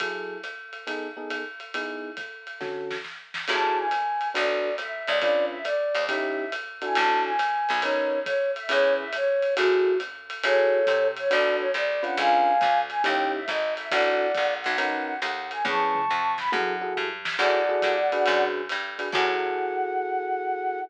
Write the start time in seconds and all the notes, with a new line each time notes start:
0.00 F#3 E4 G#4 A4, kick, ride
0.43 hi-hat pedal, ride
0.73 ride
0.87 B3 D#4 G#4 A4, ride
1.17 B3 D#4 G#4 A4
1.30 hi-hat pedal, ride
1.60 ride
1.74 B3 D#4 E4 G#4, ride
2.17 kick, hi-hat pedal, ride
2.47 ride
2.61 D3 C#4 F#4 A4, kick, snare
2.91 snare
3.04 snare
3.34 snare
3.48 F#2 E4 F#4 G#4 A4 A5, crash, ride
3.78 G#5
3.91 hi-hat pedal, ride
4.21 ride
4.34 B1 D4 F#4 A4 B4 D5, ride
4.78 E5, hi-hat pedal, ride
5.07 C#2 D5, ride
5.20 C#4 D4 F4 B4 D5, kick, ride
5.51 E5
5.65 D5, hi-hat pedal, ride
5.95 D#2, ride
6.07 C#4 D#4 E4 G4 E5, kick, ride
6.52 hi-hat pedal, ride
6.82 D4 E4 F#4 A4 G#5, ride
6.94 A1 A5, ride
7.25 G#5
7.39 hi-hat pedal, ride
7.69 B1, ride
7.81 C#4 D#4 A#4 B4 C#5, ride
8.25 C#5, kick, hi-hat pedal, ride
8.55 E5, ride
8.69 E2 C#4 E4 G#4 B4 C#5, ride
8.99 E5
9.13 C#5, hi-hat pedal, ride
9.42 ride
9.57 F#2 E4 F#4 G#4 A4, ride
10.00 hi-hat pedal, ride
10.30 ride
10.43 F#2 E4 F#4 G#4 A4 C#5, ride
10.87 C3, kick, hi-hat pedal, ride
11.17 C#5, ride
11.30 B1 D4 F#4 A4 B4 D5, ride
11.60 C#5
11.74 C2 D5, hi-hat pedal, ride
12.03 C#4 D4 F4 B4 F#5, ride
12.17 C#2 F5 G#5, ride
12.61 D2, kick, hi-hat pedal, ride
12.90 G#5, ride
13.04 D#2 C#4 D#4 E4 G4 G5, ride
13.35 E5
13.48 G#1 D#5, kick, hi-hat pedal, ride
13.76 E5, ride
13.91 A1 D4 E4 F#4 A4 D5 F#5, kick, ride
14.35 A#1, kick, hi-hat pedal, ride
14.61 F#5, ride
14.66 B1
14.78 C#4 D#4 A#4 B4 F#5, ride
15.05 F#5
15.22 D#2 F#5, hi-hat pedal, ride
15.51 G#5, ride
15.65 E2 C#4 E4 G#4 B4 A5 C#6, kick, high tom
15.95 mid tom
16.09 F2, floor tom
16.38 B5, snare
16.52 F#2 E4 F#4 G#4 A4 F#5, high tom
16.81 E4 F#4 G#4 A4
16.96 G2, floor tom
17.25 snare
17.38 F#2 E4 F#4 G#4 A4 D5 F#5, crash, ride
17.69 E4 F#4 G#4 A4
17.82 G2, kick, hi-hat pedal, ride
18.12 D4 F#4 G#4 B4, ride
18.26 F#2, ride
18.69 G2, hi-hat pedal, ride
18.99 D4 F#4 G#4 B4, ride
19.12 F#2 E4 F#4 G#4 A4 F#5, kick, crash